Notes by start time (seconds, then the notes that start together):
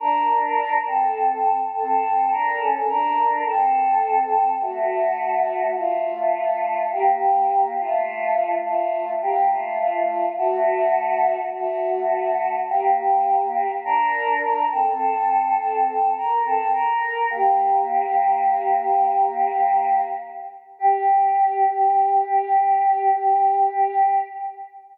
0.00 D4 A#4
0.87 C4 A4
1.74 C4 A4
2.31 D4 A#4
2.60 C#4 A4
2.88 D4 A#4
3.45 C4 A4
4.61 A3 F#4
5.75 A3 F4
6.92 A#3 G4
7.80 A3 F4
8.64 A3 F4
9.22 A#3 G4
9.50 A3 F4
9.79 A3 F4
10.38 A3 F#4
11.54 A3 F#4
12.69 A#3 G4
13.85 D4 A#4
14.71 C4 A4
15.57 C4 A4
16.17 A#4
16.44 C4 A4
16.73 A#4
17.30 A#3 G4
20.79 G4